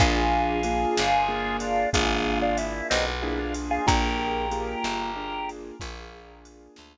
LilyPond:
<<
  \new Staff \with { instrumentName = "Drawbar Organ" } { \time 12/8 \key bes \major \tempo 4. = 62 <f' aes'>2~ <f' aes'>8 <d' f'>8 <f' aes'>8. <d' f'>16 fes'8 <c' ees'>16 r16 e'16 <d' f'>16 r16 <f' aes'>16 | <g' bes'>2. r2. | }
  \new Staff \with { instrumentName = "Acoustic Grand Piano" } { \time 12/8 \key bes \major <bes d' f' aes'>4 <bes d' f' aes'>4 <bes d' f' aes'>4 <bes d' f' aes'>2 <bes d' f' aes'>4 | <bes d' f' aes'>4 <bes d' f' aes'>4 <bes d' f' aes'>4 <bes d' f' aes'>2 r4 | }
  \new Staff \with { instrumentName = "Electric Bass (finger)" } { \clef bass \time 12/8 \key bes \major bes,,4. g,,4. aes,,4. b,,4. | bes,,4. g,,4. bes,,4. d,4. | }
  \new DrumStaff \with { instrumentName = "Drums" } \drummode { \time 12/8 <bd cymr>4 cymr8 sn4 cymr8 <bd cymr>4 cymr8 sn4 cymr8 | <bd cymr>4 cymr8 sn4 cymr8 <bd cymr>4 cymr8 sn4. | }
>>